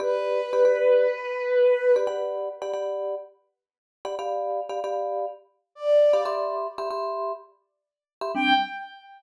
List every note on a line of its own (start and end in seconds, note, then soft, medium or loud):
0.00 0.41 G4 loud
0.00 1.95 B4 medium
0.00 0.41 D5 loud
0.00 0.41 B5 loud
0.53 0.63 G4 medium
0.53 0.63 D5 medium
0.53 0.63 B5 medium
0.65 1.07 G4 medium
0.65 1.07 D5 loud
0.65 1.07 B5 medium
1.96 2.07 G4 loud
1.96 2.07 D5 medium
1.96 2.07 B5 medium
2.07 2.49 G4 medium
2.07 2.49 D5 loud
2.07 2.49 F#5 loud
2.07 2.49 B5 loud
2.62 2.72 G4 medium
2.62 2.72 D5 loud
2.62 2.72 F#5 medium
2.62 2.72 B5 medium
2.73 3.15 G4 medium
2.73 3.15 D5 loud
2.73 3.15 F#5 medium
2.73 3.15 B5 medium
4.05 4.15 G4 medium
4.05 4.15 D5 medium
4.05 4.15 F#5 medium
4.05 4.15 B5 medium
4.19 4.61 G4 loud
4.19 4.61 D5 loud
4.19 4.61 F5 loud
4.19 4.61 B5 loud
4.69 4.80 G4 medium
4.69 4.80 D5 medium
4.69 4.80 F5 medium
4.69 4.80 B5 medium
4.84 5.26 G4 medium
4.84 5.26 D5 medium
4.84 5.26 F5 medium
4.84 5.26 B5 medium
5.75 6.26 D5 medium
6.13 6.24 G4 medium
6.13 6.24 D5 medium
6.13 6.24 F5 medium
6.13 6.24 B5 medium
6.25 6.67 G4 medium
6.25 6.67 E5 loud
6.25 6.67 B5 loud
6.25 6.67 C6 loud
6.78 6.89 G4 medium
6.78 6.89 E5 medium
6.78 6.89 B5 medium
6.78 6.89 C6 medium
6.91 7.32 G4 medium
6.91 7.32 E5 medium
6.91 7.32 B5 medium
6.91 7.32 C6 loud
8.21 8.32 G4 medium
8.21 8.32 E5 medium
8.21 8.32 B5 medium
8.21 8.32 C6 medium
8.35 8.53 G3 medium
8.35 8.53 C4 medium
8.35 8.53 D4 loud
8.35 8.53 G5 loud